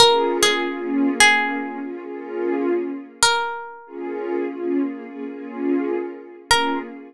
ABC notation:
X:1
M:4/4
L:1/16
Q:1/4=74
K:Bbm
V:1 name="Pizzicato Strings"
B2 A4 A4 z6 | B6 z10 | B4 z12 |]
V:2 name="Pad 2 (warm)"
[B,DFA]3 [B,DFA]3 [B,DFA]2 [B,DFA] [B,DFA] [B,DFA]6- | [B,DFA]3 [B,DFA]3 [B,DFA]2 [B,DFA] [B,DFA] [B,DFA]6 | [B,DFA]4 z12 |]